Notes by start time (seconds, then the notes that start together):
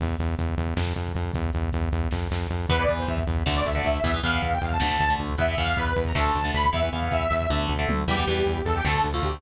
0.00 E2, kick, crash
0.09 kick
0.19 E2, kick, closed hi-hat
0.28 kick
0.38 E2, kick, closed hi-hat
0.49 kick
0.58 E2, kick
0.67 kick
0.77 F2, kick, snare
0.86 kick
0.96 F2, kick
1.07 kick
1.14 F2, kick, closed hi-hat
1.24 kick
1.33 E2, kick, closed hi-hat
1.44 kick
1.53 E2, kick, closed hi-hat
1.63 kick
1.72 E2, kick, closed hi-hat
1.82 kick
1.91 E2, kick, closed hi-hat
2.03 kick
2.11 F2, kick, snare
2.31 F2, snare
2.50 F2
2.69 E2 E3 B3 B4, kick, crash
2.79 E3 B3 D5, kick
2.87 E2 E3 B3, kick, closed hi-hat
2.98 C5, kick
3.06 E2 E5, kick, closed hi-hat
3.18 kick
3.27 E2, kick
3.37 kick
3.46 D2 D3 A3, kick, snare
3.56 D5, kick
3.65 D2 E5, kick, closed hi-hat
3.75 D3 A3 D5, kick
3.84 D2 E5, kick, closed hi-hat
3.93 E5, kick
4.04 E2 E3 B3 E5, kick, closed hi-hat
4.14 E3 B3, kick
4.23 E2 E3 B3 F5, kick, closed hi-hat
4.33 kick
4.41 E2, kick, closed hi-hat
4.52 G5, kick
4.61 E2 F5, kick, closed hi-hat
4.71 A5, kick
4.80 D2 D3 A3, kick, snare
4.90 kick
4.99 D2, kick, closed hi-hat
5.09 D3 A3, kick
5.18 D2, kick, closed hi-hat
5.29 kick
5.38 E2 E3 B3 E5, kick, closed hi-hat
5.47 E3 B3, kick
5.57 E2 E3 B3 F5, kick, closed hi-hat
5.66 kick
5.76 E2 B4, kick, closed hi-hat
5.87 kick
5.96 E2, kick, closed hi-hat
6.05 A#5, kick
6.15 D2 D3 A3 A5, kick, snare
6.25 kick
6.33 D2, kick, closed hi-hat
6.43 D3 A3, kick
6.53 D2 B5, kick, closed hi-hat
6.64 kick
6.72 E2 E3 B3 E5, kick, closed hi-hat
6.82 E3 B3, kick
6.92 E2 E3 B3 F5, kick, closed hi-hat
7.02 kick
7.11 E2 E5, kick, closed hi-hat
7.20 kick
7.30 E2, kick, closed hi-hat
7.41 kick
7.50 D2 D3 A3, kick, high tom
7.68 D2, floor tom
7.79 D3 A3
7.89 D2, mid tom
8.08 E2 E3 G3 B3 G4, kick, crash
8.17 E3 G3 B3, kick
8.27 E2 E3 G3 B3 G4, kick, closed hi-hat
8.37 kick
8.46 E2, kick, closed hi-hat
8.56 kick
8.65 E2 A4, kick, closed hi-hat
8.74 G4, kick
8.85 D2 D3 A3 A4, kick, snare
8.94 A4, kick
9.04 D2, kick, closed hi-hat
9.13 D3 A3 F4, kick
9.22 D2 G4, kick, closed hi-hat
9.32 kick